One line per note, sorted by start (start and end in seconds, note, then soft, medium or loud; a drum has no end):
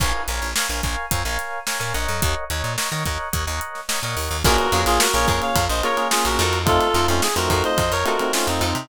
0.00 0.13 A#1 loud
0.00 0.22 A#4 medium
0.00 0.22 C#5 medium
0.00 0.22 F5 medium
0.00 0.22 G#5 medium
0.00 kick medium
0.00 crash medium
0.28 0.40 A#1 medium
0.28 0.51 A#4 medium
0.28 0.51 C#5 medium
0.28 0.51 F5 medium
0.28 0.51 G#5 medium
0.28 closed hi-hat medium
0.42 0.54 A#1 medium
0.56 0.67 A#4 medium
0.56 0.67 C#5 medium
0.56 0.67 F5 medium
0.56 0.67 G#5 medium
0.56 snare medium
0.69 0.82 A#1 medium
0.69 0.81 A#4 medium
0.69 0.81 C#5 medium
0.69 0.81 F5 medium
0.69 0.81 G#5 medium
0.83 0.96 A#1 medium
0.83 1.06 A#4 medium
0.83 1.06 C#5 medium
0.83 1.06 F5 medium
0.83 1.06 G#5 medium
0.83 kick medium
0.83 closed hi-hat soft
1.11 1.24 F2 medium
1.11 1.22 A#4 medium
1.11 1.22 C#5 medium
1.11 1.22 F5 medium
1.11 1.22 G#5 medium
1.11 kick medium
1.11 closed hi-hat medium
1.25 1.38 A#1 medium
1.25 1.59 A#4 medium
1.25 1.59 C#5 medium
1.25 1.59 F5 medium
1.25 1.59 G#5 medium
1.39 snare soft
1.39 closed hi-hat medium
1.67 1.78 A#4 medium
1.67 1.78 C#5 medium
1.67 1.78 F5 medium
1.67 1.78 G#5 medium
1.67 snare medium
1.80 1.93 A#2 medium
1.80 1.93 A#4 medium
1.80 1.93 C#5 medium
1.80 1.93 F5 medium
1.80 1.93 G#5 medium
1.80 snare soft
1.94 2.07 A#1 medium
1.94 2.44 A#4 medium
1.94 2.44 C#5 medium
1.94 2.44 D#5 medium
1.94 2.44 F#5 medium
1.94 closed hi-hat medium
2.08 2.21 F2 medium
2.22 2.35 D#2 medium
2.22 kick medium
2.22 closed hi-hat medium
2.50 2.63 D#2 medium
2.50 2.73 A#4 medium
2.50 2.73 C#5 medium
2.50 2.73 D#5 medium
2.50 2.73 F#5 medium
2.50 closed hi-hat medium
2.64 2.76 A#2 medium
2.78 2.89 A#4 medium
2.78 2.89 C#5 medium
2.78 2.89 D#5 medium
2.78 2.89 F#5 medium
2.78 snare medium
2.92 3.04 D#3 medium
2.92 3.03 A#4 medium
2.92 3.03 C#5 medium
2.92 3.03 D#5 medium
2.92 3.03 F#5 medium
2.92 snare soft
3.06 3.18 D#2 medium
3.06 3.29 A#4 medium
3.06 3.29 C#5 medium
3.06 3.29 D#5 medium
3.06 3.29 F#5 medium
3.06 kick medium
3.06 snare soft
3.06 closed hi-hat medium
3.33 3.46 D#2 medium
3.33 3.44 A#4 medium
3.33 3.44 C#5 medium
3.33 3.44 D#5 medium
3.33 3.44 F#5 medium
3.33 kick medium
3.33 closed hi-hat medium
3.47 3.60 D#2 medium
3.47 3.80 A#4 medium
3.47 3.80 C#5 medium
3.47 3.80 D#5 medium
3.47 3.80 F#5 medium
3.61 closed hi-hat medium
3.75 snare soft
3.89 4.00 A#4 medium
3.89 4.00 C#5 medium
3.89 4.00 D#5 medium
3.89 4.00 F#5 medium
3.89 snare medium
4.03 4.15 A#2 medium
4.03 4.37 A#4 medium
4.03 4.37 C#5 medium
4.03 4.37 D#5 medium
4.03 4.37 F#5 medium
4.17 4.29 D#2 medium
4.17 open hi-hat medium
4.31 4.43 D#2 medium
4.44 4.57 A#1 loud
4.44 4.67 A#3 loud
4.44 4.67 C#4 loud
4.44 4.54 F4 medium
4.44 4.67 F4 loud
4.44 4.81 F#4 loud
4.44 4.67 G#4 loud
4.44 4.54 G#4 medium
4.44 4.81 A#4 loud
4.44 4.54 A#4 medium
4.44 4.54 C#5 medium
4.44 kick medium
4.44 crash loud
4.58 ride medium
4.72 4.85 F2 loud
4.72 5.06 A#3 loud
4.72 5.06 C#4 loud
4.72 4.92 F4 medium
4.72 5.06 F4 medium
4.72 5.06 G#4 medium
4.72 4.92 G#4 medium
4.72 4.92 A#4 medium
4.72 4.92 C#5 medium
4.72 ride medium
4.86 4.99 A#1 loud
4.86 4.99 F4 loud
4.86 4.99 G#4 loud
4.86 ride medium
5.00 5.13 F#4 medium
5.00 5.13 A#4 loud
5.00 snare loud
5.14 5.26 A#1 medium
5.14 5.58 A#3 medium
5.14 5.58 C#4 loud
5.14 5.58 F4 loud
5.14 5.58 G#4 medium
5.14 5.27 A#4 medium
5.14 5.27 C#5 loud
5.14 ride medium
5.28 5.40 F2 medium
5.28 5.47 F4 medium
5.28 5.47 G#4 medium
5.28 5.41 A#4 medium
5.28 5.47 A#4 medium
5.28 5.41 C#5 medium
5.28 5.47 C#5 medium
5.28 kick medium
5.28 ride medium
5.42 5.65 C#5 medium
5.42 5.65 F5 medium
5.42 snare soft
5.42 ride medium
5.56 5.68 F2 medium
5.56 kick medium
5.56 ride medium
5.69 5.82 A#1 medium
5.69 5.83 C5 medium
5.69 5.83 D#5 medium
5.69 ride medium
5.83 5.95 A#3 medium
5.83 5.95 C#4 loud
5.83 6.03 F4 medium
5.83 5.95 F4 medium
5.83 5.95 G#4 medium
5.83 6.03 G#4 medium
5.83 6.07 A#4 medium
5.83 6.03 A#4 medium
5.83 6.07 C#5 loud
5.83 6.03 C#5 medium
5.83 ride medium
5.97 6.42 A#3 medium
5.97 6.42 C#4 medium
5.97 6.42 F4 medium
5.97 6.42 G#4 medium
5.97 ride medium
6.11 6.24 F4 medium
6.11 6.24 G#4 medium
6.11 snare medium
6.25 6.38 A#1 medium
6.25 6.59 F#4 medium
6.25 6.59 A#4 medium
6.25 snare soft
6.25 ride medium
6.39 6.79 F2 loud
6.39 6.77 D#4 medium
6.39 6.77 F4 medium
6.39 6.77 A4 medium
6.39 6.77 C5 medium
6.39 ride medium
6.53 snare soft
6.53 ride medium
6.66 6.88 A3 loud
6.66 6.88 C4 loud
6.66 6.88 D#4 loud
6.66 6.88 F4 loud
6.66 7.06 F4 loud
6.66 7.06 A4 loud
6.66 kick medium
6.66 ride medium
6.81 ride medium
6.94 7.07 F2 medium
6.94 7.27 A3 medium
6.94 7.27 C4 medium
6.94 7.27 D#4 medium
6.94 7.14 D#4 medium
6.94 7.27 F4 medium
6.94 7.14 F4 medium
6.94 7.14 A4 medium
6.94 7.14 C5 medium
6.94 snare soft
6.94 ride medium
7.08 7.21 F2 medium
7.08 7.21 C#4 medium
7.08 7.21 F4 medium
7.08 ride medium
7.22 7.35 G#4 loud
7.22 snare medium
7.36 7.49 F2 medium
7.36 7.80 A3 medium
7.36 7.80 C4 medium
7.36 7.80 D#4 medium
7.36 7.80 F4 medium
7.36 7.49 F#4 medium
7.36 7.49 A#4 medium
7.36 ride medium
7.50 7.63 F2 medium
7.50 7.69 D#4 medium
7.50 7.69 F4 medium
7.50 7.63 F#4 medium
7.50 7.69 A4 medium
7.50 7.63 A#4 loud
7.50 7.69 C5 medium
7.50 kick medium
7.50 ride medium
7.64 7.91 C5 medium
7.64 7.91 D#5 loud
7.64 ride medium
7.78 7.90 F2 medium
7.78 kick medium
7.78 ride medium
7.92 8.04 F2 medium
7.92 8.05 A#4 medium
7.92 8.05 C#5 loud
7.92 ride medium
8.05 8.16 A3 medium
8.05 8.16 C4 medium
8.05 8.16 D#4 medium
8.05 8.26 D#4 medium
8.05 8.16 F4 medium
8.05 8.26 F4 medium
8.05 8.32 F#4 medium
8.05 8.26 A4 medium
8.05 8.32 A#4 medium
8.05 8.26 C5 medium
8.05 ride medium
8.19 8.65 A3 medium
8.19 8.65 C4 loud
8.19 8.65 D#4 medium
8.19 8.65 F4 medium
8.19 ride medium
8.33 8.46 C#4 medium
8.33 8.46 F4 medium
8.33 snare medium
8.47 8.60 F2 medium
8.47 8.86 C4 medium
8.47 8.86 D#4 medium
8.47 ride medium
8.61 8.73 F2 medium
8.61 8.70 D#4 medium
8.61 8.70 F4 medium
8.61 8.70 A4 medium
8.61 8.70 C5 medium
8.61 ride medium
8.75 8.88 C3 medium
8.75 ride medium